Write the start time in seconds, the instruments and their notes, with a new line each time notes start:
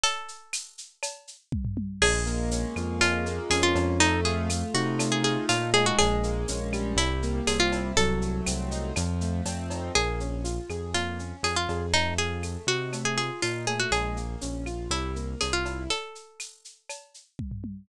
0.04 acoustic guitar (steel) A4, cowbell, shaker
0.28 shaker
0.53 tambourine, claves, shaker
0.78 shaker
1.03 cowbell, claves, shaker
1.27 shaker
1.52 kick, high tom
1.65 floor tom
1.77 high tom
2.01 synth bass 1 A#1, acoustic grand piano G#3, acoustic guitar (steel) G#4, crash, cowbell, claves
2.26 acoustic grand piano A#3, shaker
2.51 acoustic grand piano C#4, tambourine, shaker
2.76 synth bass 1 F2, acoustic grand piano F4, claves, shaker
3.01 acoustic grand piano G#3, acoustic guitar (steel) F4, cowbell, shaker
3.26 acoustic grand piano A#3, shaker
3.50 synth bass 1 F2, acoustic grand piano C#4, acoustic guitar (steel) G#4, tambourine, cowbell, claves, shaker
3.63 acoustic guitar (steel) F4
3.75 synth bass 1 F2, acoustic grand piano F4, cowbell, shaker
4.00 acoustic grand piano A3, acoustic guitar (steel) D#4, cowbell, shaker
4.25 acoustic grand piano F4, acoustic guitar (steel) G#4, shaker
4.50 acoustic grand piano A3, tambourine, claves, shaker
4.74 synth bass 1 C3, acoustic grand piano D#4, acoustic guitar (steel) F#4, shaker
4.99 acoustic grand piano A3, cowbell, claves, shaker
5.12 acoustic guitar (steel) G#4
5.24 acoustic grand piano F4, acoustic guitar (steel) G#4, shaker
5.49 synth bass 1 A#2, acoustic grand piano D#4, acoustic guitar (steel) F4, tambourine, cowbell, shaker
5.74 acoustic grand piano G#3, acoustic guitar (steel) G#4, cowbell, shaker
5.86 acoustic guitar (steel) F#4
5.99 synth bass 1 A#1, acoustic guitar (steel) G#4, cowbell, claves, shaker
6.23 acoustic grand piano A#3, shaker
6.48 synth bass 1 A#1, acoustic grand piano C#4, tambourine, shaker
6.73 acoustic grand piano G3, claves, shaker
6.96 synth bass 1 C2, acoustic guitar (steel) E4, cowbell, shaker
7.23 acoustic grand piano A#3, shaker
7.47 synth bass 1 C2, acoustic grand piano C4, acoustic guitar (steel) G#4, tambourine, cowbell, claves, shaker
7.60 acoustic guitar (steel) F4
7.72 acoustic grand piano E4, cowbell, shaker
7.96 synth bass 1 C2, acoustic grand piano F#3, acoustic guitar (steel) A4, cowbell, shaker
8.22 acoustic grand piano A3, shaker
8.46 synth bass 1 C2, acoustic grand piano C4, tambourine, claves, shaker
8.71 acoustic grand piano D#4, shaker
8.96 synth bass 1 F2, acoustic grand piano F3, cowbell, claves, shaker
9.21 acoustic grand piano A3, shaker
9.45 synth bass 1 F2, acoustic grand piano C4, tambourine, cowbell, shaker
9.70 acoustic grand piano D#4, cowbell, shaker
9.95 synth bass 1 A#1, acoustic grand piano A#3, acoustic guitar (steel) G#4, cowbell, claves, shaker
10.20 acoustic grand piano C#4, shaker
10.44 acoustic grand piano F4, tambourine, shaker
10.70 synth bass 1 F2, acoustic grand piano G#4, claves, shaker
10.94 acoustic grand piano A#3, acoustic guitar (steel) F4, cowbell, shaker
11.19 acoustic grand piano C#4, shaker
11.43 synth bass 1 F2, acoustic grand piano F4, acoustic guitar (steel) G#4, tambourine, cowbell, claves, shaker
11.56 acoustic guitar (steel) F4
11.69 synth bass 1 F2, acoustic grand piano G#4, cowbell, shaker
11.94 acoustic grand piano A3, acoustic guitar (steel) D#4, cowbell, shaker
12.18 acoustic grand piano F4, acoustic guitar (steel) G#4, shaker
12.43 acoustic grand piano A3, tambourine, claves, shaker
12.67 synth bass 1 C3, acoustic grand piano D#4, acoustic guitar (steel) F#4, shaker
12.93 acoustic grand piano A3, cowbell, claves, shaker
13.05 acoustic guitar (steel) G#4
13.17 acoustic grand piano F4, acoustic guitar (steel) G#4, shaker
13.42 synth bass 1 A#2, acoustic grand piano D#4, acoustic guitar (steel) F4, tambourine, cowbell, shaker
13.67 acoustic grand piano A3, acoustic guitar (steel) G#4, cowbell, shaker
13.80 acoustic guitar (steel) F#4
13.91 synth bass 1 A#1, acoustic grand piano G#3, acoustic guitar (steel) G#4, cowbell, claves, shaker
14.16 acoustic grand piano A#3, shaker
14.41 synth bass 1 A#1, acoustic grand piano C#4, tambourine, shaker
14.66 acoustic grand piano F4, claves, shaker
14.90 synth bass 1 C2, acoustic grand piano G3, acoustic guitar (steel) E4, cowbell, shaker
15.16 acoustic grand piano A#3, shaker
15.41 synth bass 1 C2, acoustic grand piano C4, acoustic guitar (steel) G#4, tambourine, cowbell, claves, shaker
15.53 acoustic guitar (steel) F4, cowbell
15.65 acoustic grand piano E4, cowbell, shaker
15.90 acoustic guitar (steel) A4, cowbell, shaker
16.15 shaker
16.40 tambourine, claves, shaker
16.65 shaker
16.89 cowbell, claves, shaker
17.14 shaker
17.39 kick, high tom
17.51 floor tom
17.64 high tom